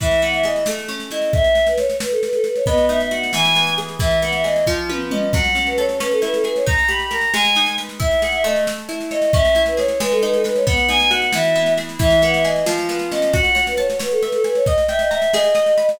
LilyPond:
<<
  \new Staff \with { instrumentName = "Choir Aahs" } { \time 6/8 \key e \major \tempo 4. = 90 e''8 fis''16 e''16 dis''8 r4 dis''8 | e''8. b'16 cis''8 b'16 a'16 b'16 a'16 b'16 cis''16 | dis''8 e''16 e''16 fis''8 gis''4 r8 | e''8 fis''16 e''16 dis''8 r4 dis''8 |
fis''8. b'16 cis''8 b'16 a'16 b'16 a'16 b'16 cis''16 | ais''8 b''16 b''16 ais''8 gis''4 r8 | e''8 fis''16 e''16 dis''8 r4 dis''8 | e''8. b'16 cis''8 b'16 a'16 b'16 a'16 b'16 cis''16 |
fis''8 gis''16 gis''16 fis''8 e''4 r8 | e''8 fis''16 e''16 dis''8 r4 dis''8 | fis''8. b'16 cis''8 b'16 a'16 b'16 a'16 b'16 cis''16 | dis''8 e''16 dis''16 e''8 dis''4. | }
  \new Staff \with { instrumentName = "Orchestral Harp" } { \time 6/8 \key e \major e8 b8 gis'8 a8 cis'8 e'8 | r2. | b8 dis'8 fis'8 e8 b8 gis'8 | e8 b8 gis'8 eis8 b8 cis'8 |
fis8 cis'8 a'8 cis'8 e'8 gis'8 | dis'8 g'8 ais'8 gis8 dis'8 b'8 | e'8 gis'8 a4 e'8 cis''8 | cis'8 e'8 gis'8 gis8 dis'8 b'8 |
b8 dis'8 fis'8 e8 b8 gis'8 | e8 b8 gis'8 eis8 b8 cis'8 | fis'8 cis''8 a''8 cis''8 e''8 gis''8 | dis''8 g''8 ais''8 gis'8 dis''8 b''8 | }
  \new DrumStaff \with { instrumentName = "Drums" } \drummode { \time 6/8 <bd sn>16 sn16 sn16 sn16 sn16 sn16 sn16 sn16 sn16 sn16 sn16 sn16 | <bd sn>16 sn16 sn16 sn16 sn16 sn16 sn16 sn16 sn16 sn16 sn16 sn16 | <bd sn>16 sn16 sn16 sn16 sn16 sn16 sn16 sn16 sn16 sn16 sn16 sn16 | <bd sn>16 sn16 sn16 sn16 sn16 sn16 <bd sn>8 tommh8 toml8 |
<cymc bd sn>16 sn16 sn16 sn16 sn16 sn16 sn16 sn16 sn16 sn16 sn16 sn16 | <bd sn>16 sn16 sn16 sn16 sn16 sn16 sn16 sn16 sn16 sn16 sn16 sn16 | <bd sn>16 sn16 sn16 sn16 sn16 sn16 sn16 sn16 sn16 sn16 sn16 sn16 | <bd sn>16 sn16 sn16 sn16 sn16 sn16 sn16 sn16 sn16 sn16 sn16 sn16 |
<bd sn>16 sn16 sn16 sn16 sn16 sn16 sn16 sn16 sn16 sn16 sn16 sn16 | <bd sn>16 sn16 sn16 sn16 sn16 sn16 sn16 sn16 sn16 sn16 sn16 sn16 | <bd sn>16 sn16 sn16 sn16 sn16 sn16 sn16 sn16 sn16 sn16 sn16 sn16 | <bd sn>16 sn16 sn16 sn16 sn16 sn16 sn16 sn16 sn16 sn16 sn16 sn16 | }
>>